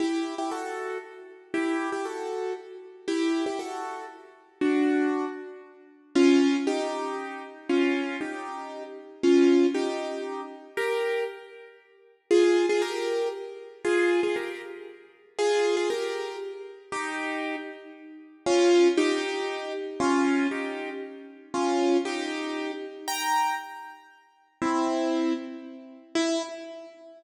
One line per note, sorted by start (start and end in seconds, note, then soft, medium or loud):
0.00 0.35 E4 medium
0.00 0.35 G4 medium
0.38 0.50 E4 medium
0.38 0.50 G4 medium
0.51 0.98 F#4 medium
0.51 0.98 A4 medium
1.54 1.90 E4 medium
1.54 1.90 G4 medium
1.92 2.04 E4 medium
1.92 2.04 G4 medium
2.05 2.53 F#4 soft
2.05 2.53 A4 medium
3.08 3.45 E4 medium
3.08 3.45 G4 medium
3.46 3.58 E4 medium
3.46 3.58 G4 medium
3.59 4.05 F#4 soft
3.59 4.05 A4 medium
4.61 5.25 D4 medium
4.61 5.25 F#4 medium
6.15 6.57 C#4 medium
6.15 6.57 F4 medium
6.67 7.42 D#4 medium
6.67 7.42 G4 medium
7.69 8.16 C#4 medium
7.69 8.16 F4 medium
8.21 8.83 D#4 soft
8.21 8.83 G4 medium
9.23 9.66 C#4 medium
9.23 9.66 F4 medium
9.74 10.41 D#4 medium
9.74 10.41 G4 medium
10.77 11.24 G4 medium
10.77 11.24 A#4 medium
12.31 12.66 F4 medium
12.31 12.66 G#4 medium
12.69 12.82 F4 medium
12.69 12.82 G#4 medium
12.82 13.28 G4 medium
12.82 13.28 A#4 medium
13.85 14.21 F4 medium
13.85 14.21 G#4 medium
14.23 14.35 F4 medium
14.23 14.35 G#4 medium
14.36 14.62 G4 soft
14.36 14.62 A#4 medium
15.39 15.75 F4 medium
15.39 15.75 G#4 medium
15.77 15.89 F4 medium
15.77 15.89 G#4 medium
15.90 16.36 G4 medium
15.90 16.36 A#4 medium
16.92 17.56 D#4 medium
16.92 17.56 G4 medium
18.46 18.88 C#4 medium
18.46 18.88 F4 medium
18.97 19.73 D#4 medium
18.97 19.73 G4 medium
20.00 20.47 C#4 medium
20.00 20.47 F4 medium
20.51 20.90 D#4 medium
20.51 20.90 G4 medium
21.54 21.97 C#4 medium
21.54 21.97 F4 medium
22.05 22.72 D#4 medium
22.05 22.72 G4 medium
23.08 23.55 G5 medium
23.08 23.55 A#5 medium
24.62 25.33 C4 medium
24.62 25.33 E4 medium
26.15 26.42 E4 loud